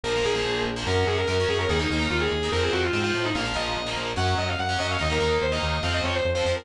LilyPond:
<<
  \new Staff \with { instrumentName = "Distortion Guitar" } { \time 4/4 \key bes \minor \tempo 4 = 145 bes'8 aes'4 r8 bes'8 aes'16 bes'16 bes'8 aes'16 bes'16 | aes'16 ees'8 r16 f'16 aes'8. bes'16 aes'16 ges'16 f'16 r16 f'8 ees'16 | f''8 ees''4 r8 ges''8 ees''16 f''16 ges''8 ees''16 f''16 | ees''16 bes'8 r16 c''16 ees''8. f''16 ees''16 des''16 c''16 r16 c''8 bes'16 | }
  \new Staff \with { instrumentName = "Overdriven Guitar" } { \time 4/4 \key bes \minor <f bes>16 <f bes>16 <f bes>16 <f bes>4 <f bes>16 <ges des'>4 <ges des'>16 <ges des'>8. | <bes ees'>16 <bes ees'>16 <bes ees'>16 <bes ees'>4 <bes ees'>16 <f c'>4 <f c'>16 <f c'>8. | <f bes>16 <f bes>16 <f bes>8. <f bes>8. <ges des'>4~ <ges des'>16 <ges des'>16 <ges des'>8 | <bes ees'>16 <bes ees'>16 <bes ees'>8. <bes ees'>8. <f c'>4~ <f c'>16 <f c'>16 <f c'>8 | }
  \new Staff \with { instrumentName = "Synth Bass 1" } { \clef bass \time 4/4 \key bes \minor bes,,8 bes,,8 bes,,8 bes,,8 ges,8 ges,8 ges,8 ges,8 | ees,8 ees,8 ees,8 ees,8 f,8 f,8 aes,8 a,8 | bes,,8 bes,,8 bes,,8 bes,,8 ges,8 ges,8 ges,8 ges,8 | ees,8 ees,8 ees,8 ees,8 f,8 f,8 f,8 f,8 | }
>>